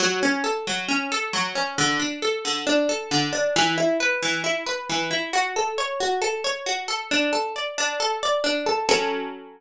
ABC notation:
X:1
M:4/4
L:1/8
Q:1/4=135
K:F#m
V:1 name="Harpsichord"
F, C A F, C A F, C | D, D A D, D A D, D | E, E B E, E B E, E | F A c F A c F A |
D A d D A d D A | [F,CA]8 |]